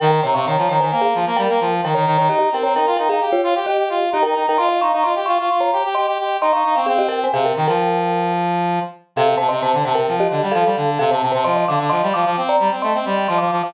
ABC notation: X:1
M:5/4
L:1/16
Q:1/4=131
K:Ebmix
V:1 name="Marimba"
[Bg] [Bg] [db] [fd'] [db]2 [db] [ca]2 [Af]2 z [Bg]4 [Bg] [db]2 [db] | [Ge] [Ge] [Bg] [db] [Bg]2 [Bg] [Af]2 [Fd]2 z [Ge]4 [Ge] [Bg]2 [Bg] | [ec'] [ec'] [fd'] [fd'] [ec']2 [fd'] [fd']2 [db]2 z [ec']4 [ec'] [fd']2 [fd'] | [Af] [Ge] [Bg] [ca] [Af] [Bg]2 [Bg]7 z6 |
[K:Fmix] [Af] [Af] [ca] [ec'] [ca]2 [ca] [Bg]2 [Ge]2 z [Af]4 [Af] [ca]2 [ca] | [ec'] [ec'] [fd'] [fd'] [ec']2 [fd'] [fd']2 [db]2 z [ec']4 [ec'] [fd']2 [fd'] |]
V:2 name="Brass Section"
E,2 C, C, E, F, E, E, B,2 F, B, G, B, F,2 E, E, E, E, | E2 C C E F E E G2 F G G G F2 E E E E | F2 E E F G F F F2 G G G G G2 E E E C | C4 C,2 E, F,11 z2 |
[K:Fmix] C,2 C, C, C, D, C, C, F,2 D, G, F, G, D,2 C, C, C, C, | F,2 D, D, F, G, F, F, C2 G, C A, C G,2 F, F, F, F, |]